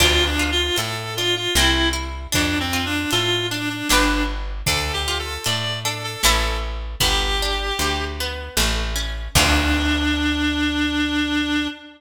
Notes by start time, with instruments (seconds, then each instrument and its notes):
0.00 electric bass (finger) D2, orchestral harp D4, clarinet F4, kick, crash
0.26 clarinet D4
0.39 orchestral harp F4
0.52 clarinet F4
0.76 electric bass (finger) A2, orchestral harp A4, clarinet A4, closed hi-hat
1.17 orchestral harp D4, clarinet F4
1.36 clarinet F4
1.55 electric bass (finger) C2, orchestral harp C4, clarinet E4, snare
1.93 orchestral harp E4
2.32 electric bass (finger) F2, orchestral harp D4, clarinet D4, kick, closed hi-hat
2.60 clarinet C4
2.73 orchestral harp F4
2.86 clarinet D4
3.11 electric bass (finger) A2, clarinet F4, orchestral harp A4, closed hi-hat
3.50 clarinet D4, orchestral harp D4
3.70 clarinet D4
3.89 electric bass (finger) G1, clarinet D4, orchestral harp D4 G4 B4, snare
4.66 electric bass (finger) D2, orchestral harp D4, clarinet A4, kick, closed hi-hat
4.93 clarinet G4
5.08 orchestral harp F4
5.19 clarinet A4
5.44 electric bass (finger) A2, orchestral harp A4, clarinet D5, closed hi-hat
5.85 orchestral harp D4, clarinet A4
6.04 clarinet A4
6.23 electric bass (finger) A1, orchestral harp C#4 E4 A4, clarinet A4, snare
7.00 electric bass (finger) G1, orchestral harp B3, clarinet G4, kick, closed hi-hat
7.42 orchestral harp D4
7.79 electric bass (finger) D2, orchestral harp G4, closed hi-hat
8.20 orchestral harp B3
8.57 electric bass (finger) A1, orchestral harp A3, snare
8.95 orchestral harp C#4
9.35 electric bass (finger) D2, clarinet D4, orchestral harp D4 F4 A4, kick, crash